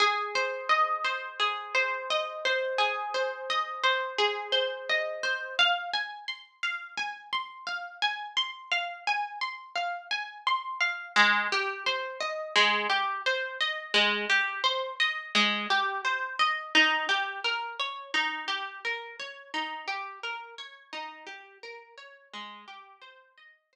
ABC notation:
X:1
M:4/4
L:1/8
Q:1/4=86
K:Ablyd
V:1 name="Orchestral Harp"
A c e c A c e c | A c e c A c e c | f a c' f a c' f a | c' f a c' f a c' f |
A, G c e A, G c e | A, G c e A, G c e | E G B _d E G B d | E G B _d E G B d |
A, G c e c z3 |]